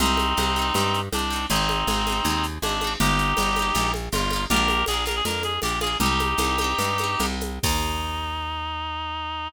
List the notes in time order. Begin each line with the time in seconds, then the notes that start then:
0.00 C2 C4 D#4 G4, low conga, shaker
0.06 C4
0.17 high conga, shaker
0.37 C2 D#4 G4, high conga, shaker
0.43 C4
0.56 D#4 G4, shaker
0.62 C4
0.74 G2 D#4 G4, low conga, shaker
0.80 C4
0.94 shaker
1.12 C2 D4 D#4 G4, high conga, shaker
1.19 C4
1.30 D#4 G4, shaker
1.36 C4
1.49 G#1 C4 D#4 G#4, low conga, shaker
1.56 C4
1.69 high conga, shaker
1.87 G#1 D#4 G#4, high conga, shaker
1.93 C4
2.06 D#4 G#4, high conga, shaker
2.12 C4
2.24 D#2 D#4 G#4, low conga, shaker
2.30 C4
2.43 shaker
2.62 G#1 D4 D#4 G#4, high conga, shaker
2.69 C4
2.81 D#4 G#4, high conga, shaker
2.87 C4
3.00 G1 D#4 G4, low conga, shaker
3.06 A#3
3.18 shaker
3.37 G1 D#4 G4, high conga, shaker
3.43 A#3
3.56 D#4 G4, high conga, shaker
3.62 A#3
3.75 A#1 D#4 G4, low conga, shaker
3.80 A#3
3.94 high conga, shaker
4.12 G1 D#4 F4 G4, high conga, shaker
4.18 A#3
4.30 D#4 G4, high conga, shaker
4.36 A#3
4.50 A#1 D4 F4 G4 A#4, low conga, shaker
4.56 A#3
4.68 high conga, shaker
4.86 A#1 F4 G#4, high conga, shaker
4.91 A#3 D4
5.06 D4 F4 A#4, high conga, shaker
5.11 A#3
5.16 G#4
5.25 F2 D4 F4 A#4, low conga, shaker
5.31 A#3
5.43 G#4, high conga, shaker
5.62 A#1 D4 F4 G4, high conga, shaker
5.68 A#3
5.80 D4 F4 G#4, high conga, shaker
5.87 A#3
6.00 C2 D#4 G4, low conga, shaker
6.06 C4
6.19 high conga, shaker
6.37 C2 G4, high conga, shaker
6.42 C4 D#4
6.58 D#4 G4, high conga, shaker
6.64 C4
6.78 G2 D#4 G4, low conga, shaker
6.84 C4
6.98 D#4 G4, high conga, shaker
7.04 C4
7.19 C2 D#4 G4, high conga, shaker
7.26 C4
7.41 high conga, shaker
7.63 D#2 D#4 G4, kick, crash
7.69 A#3